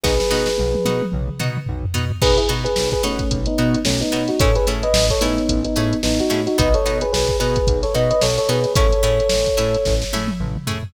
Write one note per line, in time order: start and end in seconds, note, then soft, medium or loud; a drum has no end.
0.04 0.21 B1 medium
0.04 0.15 B3 medium
0.04 0.15 D#4 medium
0.04 0.15 F#4 medium
0.04 1.02 G#4 medium
0.04 1.02 B4 medium
0.04 kick medium
0.04 snare medium
0.20 snare medium
0.31 0.49 B2 medium
0.31 0.51 B3 medium
0.31 0.51 D#4 medium
0.31 0.51 F#4 medium
0.31 snare medium
0.46 snare medium
0.58 0.77 B1 medium
0.58 high tom medium
0.74 high tom medium
0.85 1.02 B2 medium
0.85 1.06 B3 medium
0.85 1.06 D#4 medium
0.85 1.06 F#4 medium
0.85 high tom medium
1.02 high tom medium
1.12 1.30 B1 medium
1.12 mid tom medium
1.28 mid tom medium
1.39 1.58 B2 medium
1.39 1.60 B3 medium
1.39 1.60 D#4 medium
1.39 1.60 F#4 medium
1.39 mid tom medium
1.57 mid tom medium
1.66 1.86 B1 medium
1.66 floor tom medium
1.83 floor tom medium
1.94 2.12 B2 medium
1.94 2.05 B3 medium
1.94 2.05 D#4 medium
1.94 2.05 F#4 medium
1.94 floor tom medium
2.11 floor tom loud
2.22 2.39 B1 medium
2.22 2.33 B3 medium
2.22 2.33 D#4 medium
2.22 2.33 F#4 medium
2.22 2.37 G#4 loud
2.22 2.37 B4 loud
2.22 kick medium
2.22 crash medium
2.38 2.48 E4 medium
2.38 2.48 G#4 loud
2.38 closed hi-hat medium
2.49 2.67 B2 medium
2.49 2.69 B3 medium
2.49 2.69 D#4 medium
2.49 2.69 F#4 medium
2.49 closed hi-hat medium
2.64 2.89 G#4 medium
2.64 2.89 B4 medium
2.64 closed hi-hat medium
2.76 2.95 B1 medium
2.76 snare medium
2.91 3.03 G#4 medium
2.91 3.03 B4 medium
2.91 kick medium
2.91 closed hi-hat medium
3.03 3.21 B2 medium
3.03 3.39 A3 medium
3.03 3.24 B3 medium
3.03 3.39 C#4 medium
3.03 3.24 D#4 medium
3.03 3.24 F#4 medium
3.03 snare soft
3.03 closed hi-hat medium
3.19 kick medium
3.19 closed hi-hat medium
3.31 3.48 B1 medium
3.31 kick medium
3.31 closed hi-hat medium
3.46 3.79 B3 medium
3.46 3.79 D#4 medium
3.46 closed hi-hat medium
3.58 3.76 B2 medium
3.58 3.79 B3 medium
3.58 3.79 D#4 medium
3.58 3.79 F#4 medium
3.58 closed hi-hat medium
3.74 closed hi-hat medium
3.85 4.03 B1 medium
3.85 4.00 A3 medium
3.85 4.00 C#4 loud
3.85 snare loud
4.01 4.27 B3 medium
4.01 4.27 D#4 medium
4.01 closed hi-hat medium
4.12 4.31 B2 medium
4.12 4.23 B3 medium
4.12 4.23 D#4 medium
4.12 4.23 F#4 medium
4.12 closed hi-hat medium
4.28 4.39 D#4 medium
4.28 4.39 F#4 medium
4.28 snare soft
4.28 closed hi-hat medium
4.40 4.57 A1 medium
4.40 4.51 A3 medium
4.40 4.51 C#4 medium
4.40 4.51 E4 medium
4.40 4.51 G#4 medium
4.40 4.55 A4 medium
4.40 4.55 C#5 medium
4.40 kick loud
4.40 closed hi-hat medium
4.55 4.66 G#4 medium
4.55 4.66 B4 medium
4.55 closed hi-hat medium
4.67 4.85 A2 medium
4.67 4.88 A3 medium
4.67 4.88 C#4 medium
4.67 4.88 E4 medium
4.67 4.88 G#4 medium
4.67 closed hi-hat medium
4.83 5.05 B4 medium
4.83 5.05 D#5 medium
4.83 closed hi-hat medium
4.93 5.11 A1 medium
4.93 snare loud
5.10 5.21 A4 medium
5.10 5.21 C#5 medium
5.10 kick medium
5.10 closed hi-hat medium
5.21 5.39 A2 medium
5.21 5.42 A3 medium
5.21 5.60 B3 medium
5.21 5.42 C#4 medium
5.21 5.60 D#4 medium
5.21 5.42 E4 medium
5.21 5.42 G#4 medium
5.21 closed hi-hat medium
5.38 closed hi-hat medium
5.49 5.67 A1 medium
5.49 kick medium
5.49 closed hi-hat loud
5.65 5.97 B3 medium
5.65 5.97 D#4 medium
5.65 closed hi-hat medium
5.76 5.94 A2 medium
5.76 5.97 A3 medium
5.76 5.97 C#4 medium
5.76 5.97 E4 medium
5.76 5.97 G#4 medium
5.76 closed hi-hat medium
5.93 closed hi-hat medium
6.03 6.21 A1 medium
6.03 6.18 B3 medium
6.03 6.18 D#4 medium
6.03 snare medium
6.20 6.41 D#4 medium
6.20 6.41 F#4 medium
6.20 closed hi-hat medium
6.30 6.48 A2 medium
6.30 6.41 A3 medium
6.30 6.41 C#4 medium
6.30 6.41 E4 medium
6.30 6.41 G#4 medium
6.30 snare soft
6.30 closed hi-hat medium
6.47 6.58 D#4 medium
6.47 6.58 F#4 medium
6.47 snare soft
6.47 closed hi-hat medium
6.58 6.76 B1 loud
6.58 6.69 B3 medium
6.58 6.69 D#4 medium
6.58 6.69 F#4 medium
6.58 6.74 B4 medium
6.58 6.74 D#5 medium
6.58 kick medium
6.58 closed hi-hat medium
6.74 6.98 A4 medium
6.74 6.98 C#5 medium
6.74 closed hi-hat medium
6.86 7.04 B2 medium
6.86 7.06 B3 medium
6.86 7.06 D#4 medium
6.86 7.06 F#4 medium
6.86 snare soft
6.86 closed hi-hat medium
7.01 7.12 G#4 medium
7.01 7.12 B4 medium
7.01 closed hi-hat medium
7.13 7.31 B1 medium
7.13 7.37 G#4 medium
7.13 7.37 B4 medium
7.13 snare medium
7.27 kick medium
7.27 closed hi-hat medium
7.40 7.58 B2 medium
7.40 7.61 B3 medium
7.40 7.61 D#4 medium
7.40 7.61 F#4 medium
7.40 7.80 G#4 medium
7.40 7.80 B4 medium
7.40 closed hi-hat medium
7.56 kick medium
7.56 closed hi-hat medium
7.67 7.85 B1 medium
7.67 kick medium
7.67 closed hi-hat medium
7.83 7.94 A4 medium
7.83 7.94 C#5 medium
7.83 snare soft
7.83 closed hi-hat medium
7.94 8.13 B2 medium
7.94 8.15 B3 medium
7.94 8.15 D#4 medium
7.94 8.15 F#4 medium
7.94 8.10 B4 medium
7.94 8.10 D#5 medium
7.94 closed hi-hat medium
8.11 8.21 B4 medium
8.11 8.21 D#5 medium
8.11 closed hi-hat medium
8.21 8.40 B1 medium
8.21 8.37 A4 medium
8.21 8.37 C#5 medium
8.21 snare medium
8.38 8.49 A4 medium
8.38 8.49 C#5 medium
8.38 closed hi-hat medium
8.49 8.66 B2 medium
8.49 8.60 B3 medium
8.49 8.60 D#4 medium
8.49 8.60 F#4 medium
8.49 8.73 G#4 medium
8.49 8.73 B4 medium
8.49 closed hi-hat medium
8.64 snare soft
8.64 closed hi-hat medium
8.75 8.93 A1 medium
8.75 8.87 A3 medium
8.75 8.87 C#4 loud
8.75 8.87 E4 medium
8.75 8.87 G#4 medium
8.75 9.94 A4 medium
8.75 9.94 C#5 loud
8.75 kick loud
8.75 closed hi-hat medium
8.93 closed hi-hat medium
9.03 9.21 A2 medium
9.03 9.23 A3 medium
9.03 9.23 C#4 medium
9.03 9.23 E4 medium
9.03 9.23 G#4 medium
9.03 closed hi-hat medium
9.20 closed hi-hat medium
9.29 9.50 A1 medium
9.29 snare medium
9.46 kick medium
9.46 closed hi-hat medium
9.57 9.76 A2 medium
9.57 9.78 A3 medium
9.57 9.78 C#4 medium
9.57 9.78 E4 medium
9.57 9.78 G#4 medium
9.57 closed hi-hat medium
9.74 closed hi-hat medium
9.85 10.04 A1 medium
9.85 kick medium
9.85 snare medium
10.02 snare medium
10.13 10.31 A2 medium
10.13 10.34 A3 medium
10.13 10.34 C#4 medium
10.13 10.34 E4 medium
10.13 10.34 G#4 medium
10.13 high tom medium
10.28 high tom medium
10.40 10.58 A1 medium
10.40 mid tom medium
10.56 mid tom medium
10.67 10.84 A2 medium
10.67 10.78 A3 medium
10.67 10.78 C#4 medium
10.67 10.78 E4 medium
10.67 10.78 G#4 medium
10.67 floor tom medium
10.83 floor tom medium